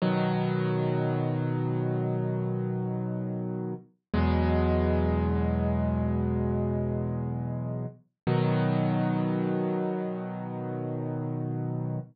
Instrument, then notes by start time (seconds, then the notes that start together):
acoustic grand piano
0.02 B2 D#3 F#3
4.14 E2 B2 F#3 G#3
8.27 B2 D#3 F#3